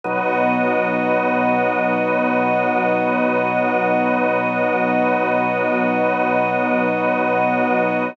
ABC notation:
X:1
M:4/4
L:1/8
Q:1/4=59
K:F#mix
V:1 name="Drawbar Organ"
[B,,F,D]8- | [B,,F,D]8 |]
V:2 name="String Ensemble 1"
[B,Fd]8- | [B,Fd]8 |]